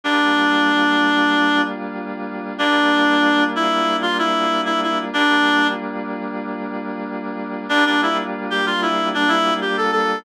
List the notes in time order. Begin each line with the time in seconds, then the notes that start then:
0.04 G3 A#3 D4 F4
2.58 G3 A#3 D4 F4
3.55 E4
4.02 F4
4.18 E4
4.65 E4
4.83 E4
5.13 G3 A#3 D4 F4
7.69 G3 A#3 D4 F4
7.86 D4
8.02 E4
8.50 G4
8.66 F4
8.82 E4
9.14 D4
9.28 E4
9.61 G4
9.77 A4
9.92 A4